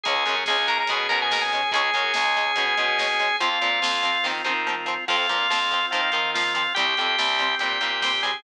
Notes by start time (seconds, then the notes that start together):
0.03 C#2 G#3 C#4 G#4 G#5, kick, closed hi-hat
0.08 C#4
0.15 kick
0.26 F#2 G#3 C#4, kick, closed hi-hat
0.37 kick
0.46 C#2 G#3 G#4 G#5, kick, snare
0.50 C#4
0.56 kick
0.68 G#3 C#4 A#4 A#5, kick, closed hi-hat
0.78 A#4 A#5, kick
0.87 B2 G#3 G#4 G#5, kick, closed hi-hat
0.92 C#4
1.00 kick
1.09 B2 G#3 C#4 A#4 A#5, kick, closed hi-hat
1.20 G#4 G#5, kick
1.31 G#3 C#4 A#4 A#5, kick, snare
1.41 G#4 G#5, kick
1.50 G#3, kick, closed hi-hat
1.55 C#4
1.63 kick
1.72 C#2 G#3 C#4 G#4 G#5, kick, closed hi-hat
1.76 C#4
1.85 kick
1.94 F#2 G#3 C#4, kick, closed hi-hat
2.04 kick
2.14 C#2 G#3 C#4, kick, snare
2.25 kick
2.37 G#3 C#4, kick, closed hi-hat
2.47 kick
2.56 B2 G#3 C#4, kick, closed hi-hat
2.67 kick
2.77 B2 G#3 C#4, kick, closed hi-hat
2.88 kick
2.99 G#3 C#4, kick, snare
3.11 kick
3.20 G#3 C#4, kick, closed hi-hat
3.29 kick
3.40 F2 F3 C4 F4 F5, kick, closed hi-hat
3.52 kick
3.61 A#2 F3 C4, kick, closed hi-hat
3.72 kick
3.82 F2 F3 C4, kick, snare
3.94 kick
4.03 F3 C4, kick, closed hi-hat
4.15 kick
4.24 D#3 F3 C4, kick, snare
4.44 D#3 F3 C4, high tom
4.67 F3 C4, mid tom
4.86 F3 C4
5.08 F2 F3 C4 F4 F5, kick, crash
5.19 kick
5.29 A#2 F3 C4, kick, closed hi-hat
5.40 kick
5.49 F2 F3 C4, kick, snare
5.60 kick
5.71 F3 C4, kick, closed hi-hat
5.83 kick
5.91 D#3 F3 C4 F4 F5, kick, closed hi-hat
6.03 kick
6.12 D#3 F3 C4, kick, closed hi-hat
6.25 kick
6.34 F3 C4 F4 F5, kick, snare
6.46 kick
6.54 F3 C4 F4 F5, kick, closed hi-hat
6.67 kick
6.75 C2 G3 C4 G4 G5, kick, closed hi-hat
6.79 C4
6.88 kick
6.97 F2 G3 C4, kick, closed hi-hat
7.07 kick
7.18 C2 G3 C4, kick, snare
7.28 kick
7.39 G3 C4, kick, closed hi-hat
7.50 kick
7.59 A#2 G3 G4 G5, kick, closed hi-hat
7.63 C4
7.72 kick
7.81 A#2 G3 C4, kick, closed hi-hat
7.90 kick
8.02 G3 C4 G4 G5, kick, snare
8.14 kick
8.23 G3 C4 G#4 G#5, kick, closed hi-hat
8.34 kick